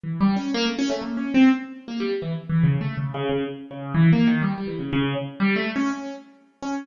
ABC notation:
X:1
M:2/4
L:1/16
Q:1/4=123
K:none
V:1 name="Acoustic Grand Piano"
(3E,2 G,2 ^C2 ^A, =A, C A, | (3^A,2 ^C2 =C2 z3 A, | G, z E, z (3E,2 ^C,2 A,2 | (3^C,2 C,2 C,2 z2 C,2 |
(3E,2 ^A,2 ^D,2 G, G, E, ^C, | ^C,2 z2 (3G,2 A,2 ^C2 | ^C2 z4 C2 |]